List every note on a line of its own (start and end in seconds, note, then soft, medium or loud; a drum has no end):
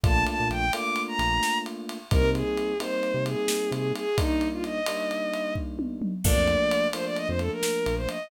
0.03 0.24 A#1 medium
0.03 0.66 A3 loud
0.03 0.66 A#3 loud
0.03 0.66 D4 loud
0.03 0.66 F4 loud
0.03 0.24 A5 loud
0.03 kick medium
0.03 ride medium
0.27 0.48 A5 medium
0.27 ride medium
0.40 0.50 A#2 medium
0.50 0.70 A#1 medium
0.50 0.72 G5 loud
0.50 ride medium
0.73 1.98 A3 medium
0.73 1.98 A#3 loud
0.73 1.98 D4 medium
0.73 1.98 F4 medium
0.73 1.02 D6 medium
0.73 ride medium
0.96 ride medium
1.08 1.58 A#5 loud
1.19 1.40 A#1 medium
1.19 ride medium
1.43 snare medium
1.66 ride medium
1.89 ride medium
2.11 2.22 C2 medium
2.11 2.73 G3 medium
2.11 2.73 A#3 medium
2.11 2.73 C4 loud
2.11 2.73 D#4 loud
2.11 2.30 A#4 loud
2.11 kick medium
2.11 ride medium
2.22 2.43 C3 medium
2.34 2.78 G#4 medium
2.34 ride medium
2.57 ride medium
2.80 4.04 G3 medium
2.80 4.04 A#3 medium
2.80 4.04 C4 medium
2.80 4.04 D#4 loud
2.80 3.24 C5 medium
2.80 ride medium
3.03 ride soft
3.14 3.35 C3 medium
3.26 3.70 G#4 medium
3.26 ride medium
3.48 snare loud
3.71 3.92 C3 medium
3.71 3.92 G#4 medium
3.71 ride medium
3.95 4.18 G#4 loud
3.95 ride medium
4.18 4.80 G3 medium
4.18 4.80 A#3 loud
4.18 4.80 D4 medium
4.18 4.80 D#4 loud
4.18 4.48 D#4 loud
4.18 kick medium
4.18 ride medium
4.41 ride medium
4.52 4.63 F4 medium
4.64 5.54 D#5 medium
4.64 ride medium
4.86 6.12 G3 medium
4.86 6.12 A#3 medium
4.86 6.12 D4 medium
4.86 6.12 D#4 medium
4.86 ride medium
5.11 ride medium
5.34 ride medium
5.55 kick medium
5.79 high tom medium
6.02 mid tom medium
6.24 6.35 A#1 medium
6.24 6.87 F3 loud
6.24 6.87 A3 loud
6.24 6.87 A#3 loud
6.24 6.87 D4 loud
6.24 6.87 D5 loud
6.24 kick medium
6.24 crash loud
6.36 6.57 F2 medium
6.48 ride medium
6.71 ride medium
6.93 8.18 F3 medium
6.93 8.18 A3 medium
6.93 8.18 A#3 medium
6.93 8.18 D4 medium
6.93 7.05 C5 loud
6.93 ride medium
7.05 7.16 D5 loud
7.16 7.28 D#5 loud
7.16 ride medium
7.28 7.49 F2 medium
7.28 7.39 C5 loud
7.39 7.51 A4 loud
7.39 ride medium
7.51 7.95 A#4 loud
7.63 snare medium
7.86 8.07 A#1 medium
7.86 ride medium
7.97 8.08 C5 loud
8.09 8.27 D#5 medium
8.09 ride medium